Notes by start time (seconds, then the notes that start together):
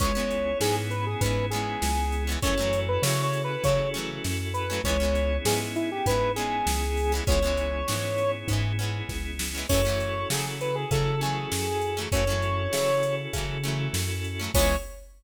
0.00 C#2 G#3 B3 C#4 E4 G#4 C#5, kick, closed hi-hat
0.04 E3
0.15 G#3 B3 C#4
0.20 E3
0.31 closed hi-hat
0.60 G#2 G#3 B3 C#4 G#4, snare
0.65 E3
0.90 B4, closed hi-hat
1.06 G#4
1.21 G#2 G#3 B3 C#4 B4, kick, closed hi-hat
1.26 E3
1.50 B3 C#4 G#4, closed hi-hat
1.55 E3 G#3
1.82 C#2, snare
2.12 closed hi-hat
2.27 G#3 B3 C#4
2.32 E3
2.42 F#2 F#3 A3 C#4 E4 F#4 A4 C#5, kick, closed hi-hat
2.47 E3
2.58 F#3 A3 C#4
2.62 E3
2.73 closed hi-hat
2.88 B4
3.02 C#3 F#3 A3 C#4 C#5, snare
3.07 E3
3.23 C#5
3.33 closed hi-hat
3.44 B4
3.64 C#3 F#3 A3 C#4 C#5, kick, closed hi-hat
3.68 E3
3.94 F#3 A3 C#4, closed hi-hat
3.98 E3
4.24 F#2, snare
4.54 B4, closed hi-hat
4.70 F#3 A3 C#4
4.74 E3
4.84 C#2 B3 C#4 E4 G#4 C#5, kick, closed hi-hat
4.88 E3 G#3
5.00 G#3 B3 C#4
5.04 E3
5.15 closed hi-hat
5.45 G#2 G#3 B3 C#4 G#4, snare
5.50 E3
5.76 E4, closed hi-hat
5.92 G4
6.06 G#2 G#3 B3 C#4 B4, kick, closed hi-hat
6.11 E3
6.36 G#3 B3 C#4 G#4, closed hi-hat
6.41 E3
6.66 C#2, snare
6.97 open hi-hat
7.12 G#3 B3 C#4
7.17 E3
7.27 C#2 G#3 B3 C#4 E4 G#4 C#5, kick, closed hi-hat
7.32 E3
7.43 G#3 B3 C#4
7.47 E3
7.57 closed hi-hat
7.88 G#2 G#3 B3 C#4, snare
7.92 E3
8.18 closed hi-hat
8.48 G#2 G#3 B3 C#4, kick, closed hi-hat
8.53 E3
8.79 G#3 B3 C#4, closed hi-hat
8.83 E3
9.09 C#2, kick, snare
9.39 snare
9.55 G#3 B3 C#4
9.59 E3
9.69 F#2 F#3 A3 C#4 E4 F#4 A4 C#5, kick, crash
9.74 E3
9.85 F#3 A3 C#4
9.89 E3
10.00 closed hi-hat
10.30 C#3 F#3 A3 C#4 G#4, snare
10.35 E3
10.61 B4, closed hi-hat
10.75 G#4
10.91 C#3 F#3 A3 C#4 A4, kick, closed hi-hat
10.95 E3
11.21 F#3 A3 C#4 G#4, closed hi-hat
11.26 E3
11.52 F#2, snare
11.82 closed hi-hat
11.97 F#3 A3 C#4
12.01 E3
12.12 F#2 F#3 A3 C#4 E4 F#4 A4 C#5, kick, closed hi-hat
12.17 E3
12.27 F#3 A3 C#4
12.32 E3
12.42 closed hi-hat
12.73 C#3 F#3 A3 C#4, snare
12.77 E3
13.03 closed hi-hat
13.33 C#3 F#3 A3 C#4, kick, closed hi-hat
13.38 E3
13.64 F#3 A3 C#4, closed hi-hat
13.68 E3
13.93 F#2, snare
14.24 closed hi-hat
14.40 F#3 A3 C#4
14.44 E3
14.54 C#2 G#3 B3 C#4 E4 G#4 C#5, kick, crash
14.59 E3